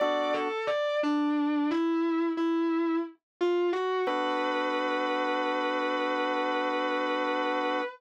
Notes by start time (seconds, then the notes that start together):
0.00 B3 D4 F#4 A4 D5
0.34 A4
0.67 D5
1.03 D4
1.71 E4
2.37 E4
3.41 F4
3.73 F#4
4.07 B3 D4 F#4 A4 B4